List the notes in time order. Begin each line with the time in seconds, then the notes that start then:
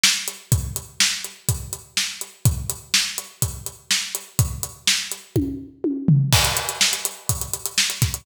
0.04 snare
0.28 closed hi-hat
0.52 kick, closed hi-hat
0.76 closed hi-hat
1.00 snare
1.24 closed hi-hat
1.49 kick, closed hi-hat
1.73 closed hi-hat
1.97 snare
2.21 closed hi-hat
2.45 kick, closed hi-hat
2.70 closed hi-hat
2.94 snare
3.18 closed hi-hat
3.42 kick, closed hi-hat
3.66 closed hi-hat
3.91 snare
4.15 closed hi-hat
4.39 kick, closed hi-hat
4.63 closed hi-hat
4.87 snare
5.12 closed hi-hat
5.36 kick, high tom
5.84 high tom
6.08 floor tom
6.33 kick, crash
6.45 closed hi-hat
6.57 closed hi-hat
6.69 closed hi-hat
6.81 snare
6.93 closed hi-hat
7.05 closed hi-hat
7.29 kick, closed hi-hat
7.41 closed hi-hat
7.54 closed hi-hat
7.66 closed hi-hat
7.78 snare
7.90 closed hi-hat
8.02 kick, snare, closed hi-hat
8.14 closed hi-hat